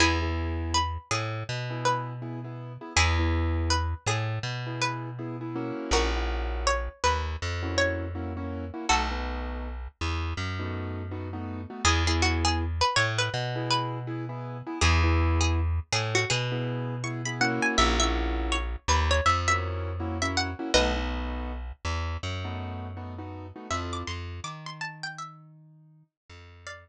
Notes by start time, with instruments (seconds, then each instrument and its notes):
0.00 electric bass (finger) E2, acoustic grand piano B3 E4 G#4, pizzicato strings E4 G#4
0.22 acoustic grand piano B3 E4 G#4
0.74 pizzicato strings B4
1.11 electric bass (finger) A2, pizzicato strings G#4
1.49 electric bass (finger) B2
1.70 acoustic grand piano B3 E4 G#4
1.85 pizzicato strings B4
2.22 acoustic grand piano B3 E4 G#4
2.44 acoustic grand piano B3 E4 G#4
2.81 acoustic grand piano B3 E4 G#4
2.96 electric bass (finger) E2, acoustic grand piano B3 E4 G#4, pizzicato strings E4 G#4
3.19 acoustic grand piano B3 E4 G#4
3.70 pizzicato strings B4
4.06 electric bass (finger) A2, pizzicato strings G#4
4.43 electric bass (finger) B2
4.67 acoustic grand piano B3 E4 G#4
4.81 pizzicato strings B4
5.19 acoustic grand piano B3 E4 G#4
5.41 acoustic grand piano B3 E4 G#4
5.56 acoustic grand piano A#3 C#4 E4 F#4
5.91 electric bass (finger) A#1, pizzicato strings F#4 A#4
6.15 acoustic grand piano A#3 C#4 E4 F#4
6.67 pizzicato strings C#5
7.04 electric bass (finger) D#2, pizzicato strings B4
7.42 electric bass (finger) F2
7.63 acoustic grand piano A#3 C#4 E4 F#4
7.78 pizzicato strings C#5
8.15 acoustic grand piano A#3 C#4 E4 F#4
8.37 acoustic grand piano A#3 C#4 E4 F#4
8.74 acoustic grand piano A#3 C#4 E4 F#4
8.89 electric bass (finger) B1, acoustic grand piano A3 B3 D#4 F#4, pizzicato strings F#4 A4
9.11 acoustic grand piano A3 B3 D#4 F#4
10.01 electric bass (finger) E2
10.37 electric bass (finger) F#2
10.59 acoustic grand piano A3 B3 D#4 F#4
11.11 acoustic grand piano A3 B3 D#4 F#4
11.33 acoustic grand piano A3 B3 D#4 F#4
11.70 acoustic grand piano A3 B3 D#4 F#4
11.85 electric bass (finger) E2, acoustic grand piano B3 E4 G#4, pizzicato strings G#4
12.07 acoustic grand piano B3 E4 G#4, pizzicato strings G#4
12.22 pizzicato strings F#4
12.45 pizzicato strings G#4
12.81 pizzicato strings B4
12.96 electric bass (finger) A2, pizzicato strings C#5
13.19 pizzicato strings B4
13.34 electric bass (finger) B2
13.55 acoustic grand piano B3 E4 G#4
13.71 pizzicato strings B4
14.07 acoustic grand piano B3 E4 G#4
14.29 acoustic grand piano B3 E4 G#4
14.67 acoustic grand piano B3 E4 G#4
14.81 electric bass (finger) E2, acoustic grand piano B3 E4 G#4, pizzicato strings G#4
15.04 acoustic grand piano B3 E4 G#4
15.41 pizzicato strings G#4
15.92 electric bass (finger) A2, pizzicato strings G#4
16.15 pizzicato strings F#4
16.30 electric bass (finger) B2, pizzicato strings G#4
16.52 acoustic grand piano B3 E4 G#4
17.04 acoustic grand piano B3 E4 G#4, pizzicato strings C#6
17.25 acoustic grand piano B3 E4 G#4, pizzicato strings B5
17.41 acoustic grand piano A#3 C#4 E4 F#4, pizzicato strings F#5
17.62 pizzicato strings G#5
17.78 electric bass (finger) A#1, pizzicato strings E5
18.00 acoustic grand piano A#3 C#4 E4 F#4, pizzicato strings E5
18.52 pizzicato strings C#5
18.88 electric bass (finger) D#2, pizzicato strings B4
19.11 pizzicato strings C#5
19.26 electric bass (finger) F2, pizzicato strings E5
19.48 acoustic grand piano A#3 C#4 E4 F#4, pizzicato strings E5
20.00 acoustic grand piano A#3 C#4 E4 F#4
20.22 acoustic grand piano A#3 C#4 E4 F#4, pizzicato strings E5
20.37 pizzicato strings F#5
20.59 acoustic grand piano A#3 C#4 E4 F#4
20.74 electric bass (finger) B1, acoustic grand piano A3 B3 D#4 F#4, pizzicato strings B4 D#5
20.96 acoustic grand piano A3 B3 D#4 F#4
21.85 electric bass (finger) E2
22.23 electric bass (finger) F#2
22.44 acoustic grand piano A3 B3 D#4 F#4
22.97 acoustic grand piano A3 B3 D#4 F#4
23.18 acoustic grand piano A3 B3 D#4 F#4
23.56 acoustic grand piano A3 B3 D#4 F#4
23.70 electric bass (finger) F2, acoustic grand piano C4 E4 F4 A4, pizzicato strings E5
23.93 pizzicato strings D6
24.07 electric bass (finger) F2, acoustic grand piano F3, pizzicato strings C6
24.44 electric bass (finger) D#3, acoustic grand piano D#4, pizzicato strings D6
24.66 pizzicato strings C6
24.81 pizzicato strings A5
25.03 pizzicato strings G5
25.18 pizzicato strings E5
26.29 electric bass (finger) F2, acoustic grand piano F3
26.67 pizzicato strings D5 F5